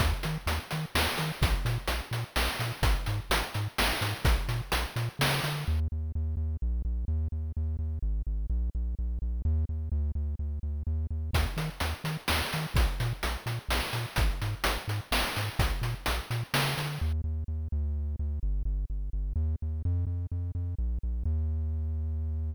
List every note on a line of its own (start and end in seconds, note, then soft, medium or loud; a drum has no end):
0.00 0.13 D#2 loud
0.00 kick medium
0.00 closed hi-hat medium
0.23 0.38 D#3 medium
0.23 closed hi-hat medium
0.46 0.59 D#2 medium
0.46 closed hi-hat medium
0.71 0.86 D#3 medium
0.71 closed hi-hat medium
0.95 1.08 D#2 medium
0.95 snare loud
1.18 1.32 D#3 medium
1.18 closed hi-hat medium
1.42 1.55 A#1 loud
1.42 kick loud
1.42 closed hi-hat medium
1.65 1.78 A#2 loud
1.65 closed hi-hat medium
1.88 2.01 A#1 medium
1.88 closed hi-hat medium
2.11 2.24 A#2 medium
2.11 closed hi-hat medium
2.36 2.49 A#1 medium
2.36 snare medium
2.59 2.72 A#2 medium
2.59 closed hi-hat medium
2.82 2.95 G#1 medium
2.82 kick medium
2.82 closed hi-hat medium
3.06 3.20 G#2 medium
3.06 closed hi-hat medium
3.30 3.43 G#1 medium
3.30 closed hi-hat loud
3.54 3.68 G#2 medium
3.54 closed hi-hat medium
3.78 3.93 G#1 medium
3.78 snare loud
4.01 4.14 G#2 medium
4.01 closed hi-hat medium
4.25 4.38 A#1 loud
4.25 kick loud
4.25 closed hi-hat medium
4.48 4.61 A#2 medium
4.48 closed hi-hat medium
4.72 4.86 A#1 medium
4.72 closed hi-hat loud
4.96 5.09 A#2 medium
4.96 closed hi-hat medium
5.19 5.40 C#3 medium
5.19 snare loud
5.43 5.65 D3 medium
5.43 closed hi-hat medium
5.68 5.88 D#2 loud
5.92 6.12 D#2 medium
6.15 6.35 D#2 loud
6.37 6.57 D#2 medium
6.62 6.82 A#1 loud
6.85 7.05 A#1 loud
7.08 7.28 D#2 loud
7.32 7.52 D#2 medium
7.57 7.77 D#2 loud
7.79 7.99 D#2 medium
8.02 8.23 G#1 loud
8.27 8.47 G#1 medium
8.50 8.70 A#1 loud
8.75 8.95 A#1 medium
8.99 9.19 A#1 medium
9.22 9.42 A#1 medium
9.45 9.65 D#2 loud
9.69 9.89 D#2 medium
9.92 10.12 D2 loud
10.15 10.35 D2 medium
10.39 10.59 D2 medium
10.63 10.83 D2 medium
10.87 11.07 D#2 loud
11.11 11.31 D#2 medium
11.33 11.46 D#2 loud
11.33 kick medium
11.33 closed hi-hat medium
11.57 11.70 D#3 medium
11.57 closed hi-hat medium
11.80 11.94 D#2 medium
11.80 closed hi-hat medium
12.04 12.17 D#3 medium
12.04 closed hi-hat medium
12.28 12.42 D#2 medium
12.28 snare loud
12.53 12.67 D#3 medium
12.53 closed hi-hat medium
12.74 12.87 A#1 loud
12.74 kick medium
12.74 closed hi-hat medium
13.00 13.13 A#2 medium
13.00 closed hi-hat medium
13.23 13.37 A#1 medium
13.23 closed hi-hat medium
13.46 13.59 A#2 medium
13.46 closed hi-hat medium
13.69 13.81 A#1 medium
13.69 snare medium
13.93 14.06 A#2 medium
13.93 closed hi-hat medium
14.16 14.31 G#1 medium
14.16 kick medium
14.16 closed hi-hat medium
14.42 14.55 G#2 medium
14.42 closed hi-hat medium
14.64 14.78 G#1 medium
14.64 closed hi-hat loud
14.88 15.01 G#2 medium
14.88 closed hi-hat medium
15.11 15.24 G#1 medium
15.11 snare loud
15.36 15.50 G#2 medium
15.36 closed hi-hat medium
15.59 15.72 A#1 loud
15.59 kick medium
15.59 closed hi-hat medium
15.82 15.95 A#2 medium
15.82 closed hi-hat medium
16.06 16.21 A#1 medium
16.06 closed hi-hat medium
16.30 16.43 A#2 medium
16.30 closed hi-hat medium
16.54 16.75 C#3 medium
16.54 snare loud
16.77 16.99 D3 medium
16.77 closed hi-hat medium
17.01 17.21 D#2 loud
17.24 17.44 D#2 medium
17.48 17.68 D#2 medium
17.72 18.16 D2 loud
18.19 18.39 D2 medium
18.43 18.63 G1 loud
18.65 18.85 G1 loud
18.90 19.10 G1 medium
19.13 19.33 G1 medium
19.36 19.56 D#2 loud
19.62 19.82 D#2 medium
19.85 20.05 F2 loud
20.07 20.27 F2 medium
20.32 20.52 F2 medium
20.55 20.75 F2 medium
20.78 20.99 A#1 loud
21.03 21.23 A#1 medium
21.25 22.54 D#2 loud